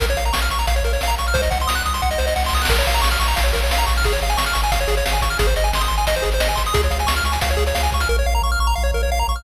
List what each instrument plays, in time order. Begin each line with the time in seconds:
0.00 synth bass 1 A#1, lead 1 (square) A#4, kick, closed hi-hat
0.09 lead 1 (square) C#5, closed hi-hat
0.17 synth bass 1 A#1, lead 1 (square) F5, closed hi-hat
0.25 lead 1 (square) A#5, closed hi-hat
0.33 synth bass 1 A#1, lead 1 (square) C#6, snare
0.42 lead 1 (square) F6, closed hi-hat
0.50 synth bass 1 A#1, lead 1 (square) C#6, closed hi-hat
0.59 lead 1 (square) A#5, closed hi-hat
0.67 synth bass 1 A#1, lead 1 (square) F5, kick, closed hi-hat
0.76 lead 1 (square) C#5, closed hi-hat
0.83 synth bass 1 A#1, lead 1 (square) A#4, closed hi-hat
0.93 lead 1 (square) C#5, closed hi-hat
1.01 synth bass 1 A#1, lead 1 (square) F5, snare
1.08 lead 1 (square) A#5, closed hi-hat
1.18 synth bass 1 A#1, lead 1 (square) C#6, closed hi-hat
1.27 lead 1 (square) F6, closed hi-hat
1.34 synth bass 1 C2, lead 1 (square) C5, kick, closed hi-hat
1.42 lead 1 (square) D#5, closed hi-hat
1.51 synth bass 1 C2, lead 1 (square) F#5, kick, closed hi-hat
1.60 lead 1 (square) C6, closed hi-hat
1.67 synth bass 1 C2, lead 1 (square) D#6, snare
1.75 lead 1 (square) F#6, closed hi-hat
1.86 synth bass 1 C2, lead 1 (square) D#6, closed hi-hat
1.94 lead 1 (square) C6, closed hi-hat
2.02 synth bass 1 C2, lead 1 (square) F#5, kick, snare
2.11 lead 1 (square) D#5, snare
2.18 synth bass 1 C2, lead 1 (square) C5, snare
2.27 lead 1 (square) D#5, snare
2.36 synth bass 1 C2, lead 1 (square) F#5, snare
2.40 snare
2.44 lead 1 (square) C6, snare
2.48 snare
2.53 synth bass 1 C2, lead 1 (square) D#6, snare
2.57 snare
2.62 lead 1 (square) F#6, snare
2.65 synth bass 1 A#1, snare
2.69 lead 1 (square) A#4, kick, crash
2.78 lead 1 (square) C#5, closed hi-hat
2.87 synth bass 1 A#1, lead 1 (square) F5, closed hi-hat
2.94 lead 1 (square) A#5, closed hi-hat
3.02 synth bass 1 A#1, lead 1 (square) C#6, snare
3.11 lead 1 (square) F6, closed hi-hat
3.20 synth bass 1 A#1, lead 1 (square) C#6, closed hi-hat
3.28 lead 1 (square) A#5, closed hi-hat
3.36 synth bass 1 A#1, lead 1 (square) F5, kick, closed hi-hat
3.44 lead 1 (square) C#5, closed hi-hat
3.53 synth bass 1 A#1, lead 1 (square) A#4, closed hi-hat
3.62 lead 1 (square) C#5, closed hi-hat
3.71 synth bass 1 A#1, lead 1 (square) F5, snare
3.78 lead 1 (square) A#5, closed hi-hat
3.86 synth bass 1 A#1, lead 1 (square) C#6, kick, closed hi-hat
3.96 lead 1 (square) F6, closed hi-hat
4.03 synth bass 1 G#1, lead 1 (square) G#4, kick, closed hi-hat
4.13 lead 1 (square) C#5, closed hi-hat
4.22 synth bass 1 G#1, lead 1 (square) F5, closed hi-hat
4.30 lead 1 (square) G#5, closed hi-hat
4.37 synth bass 1 G#1, lead 1 (square) C#6, snare
4.46 lead 1 (square) F6, closed hi-hat
4.53 synth bass 1 G#1, lead 1 (square) C#6, closed hi-hat
4.63 lead 1 (square) G#5, closed hi-hat
4.72 synth bass 1 G#1, lead 1 (square) F5, kick, closed hi-hat
4.80 lead 1 (square) C#5, closed hi-hat
4.88 synth bass 1 G#1, lead 1 (square) G#4, closed hi-hat
4.97 lead 1 (square) C#5, closed hi-hat
5.06 synth bass 1 G#1, lead 1 (square) F5, snare
5.13 lead 1 (square) G#5, closed hi-hat
5.22 synth bass 1 G#1, lead 1 (square) C#6, kick, closed hi-hat
5.30 lead 1 (square) F6, closed hi-hat
5.39 synth bass 1 G#1, lead 1 (square) G#4, kick, closed hi-hat
5.47 lead 1 (square) C5, closed hi-hat
5.56 synth bass 1 G#1, lead 1 (square) D#5, closed hi-hat
5.64 lead 1 (square) G#5, closed hi-hat
5.73 synth bass 1 G#1, lead 1 (square) C6, snare
5.81 lead 1 (square) D#6, closed hi-hat
5.88 synth bass 1 G#1, lead 1 (square) C6, closed hi-hat
5.98 lead 1 (square) G#5, closed hi-hat
6.07 synth bass 1 G#1, lead 1 (square) D#5, kick, closed hi-hat
6.15 lead 1 (square) C5, closed hi-hat
6.22 synth bass 1 G#1, lead 1 (square) G#4, closed hi-hat
6.32 lead 1 (square) C5, closed hi-hat
6.40 synth bass 1 G#1, lead 1 (square) D#5, snare
6.49 lead 1 (square) G#5, closed hi-hat
6.55 synth bass 1 G#1, lead 1 (square) C6, kick, closed hi-hat
6.66 lead 1 (square) D#6, closed hi-hat
6.74 synth bass 1 C#2, lead 1 (square) G#4, kick, closed hi-hat
6.83 lead 1 (square) C#5, closed hi-hat
6.91 synth bass 1 C#2, lead 1 (square) F5, closed hi-hat
6.99 lead 1 (square) G#5, closed hi-hat
7.07 synth bass 1 C#2, lead 1 (square) C#6, snare
7.16 lead 1 (square) F6, closed hi-hat
7.24 synth bass 1 C#2, lead 1 (square) C#6, closed hi-hat
7.32 lead 1 (square) G#5, closed hi-hat
7.41 synth bass 1 C#2, lead 1 (square) F5, kick, closed hi-hat
7.50 lead 1 (square) C#5, closed hi-hat
7.57 synth bass 1 C#2, lead 1 (square) G#4, closed hi-hat
7.67 lead 1 (square) C#5, closed hi-hat
7.75 synth bass 1 C#2, lead 1 (square) F5, snare
7.83 lead 1 (square) G#5, closed hi-hat
7.91 synth bass 1 C#2, lead 1 (square) C#6, kick, closed hi-hat
8.00 lead 1 (square) F6, closed hi-hat
8.09 synth bass 1 A#1, lead 1 (square) A#4
8.19 lead 1 (square) C#5
8.26 synth bass 1 A#1, lead 1 (square) F5
8.35 lead 1 (square) A#5
8.42 synth bass 1 A#1, lead 1 (square) C#6
8.52 lead 1 (square) F6
8.59 synth bass 1 A#1, lead 1 (square) C#6
8.67 lead 1 (square) A#5
8.75 synth bass 1 A#1, lead 1 (square) F5
8.83 lead 1 (square) C#5
8.94 synth bass 1 A#1, lead 1 (square) A#4
9.03 lead 1 (square) C#5
9.09 synth bass 1 A#1, lead 1 (square) F5
9.19 lead 1 (square) A#5
9.28 synth bass 1 A#1, lead 1 (square) C#6
9.36 lead 1 (square) F6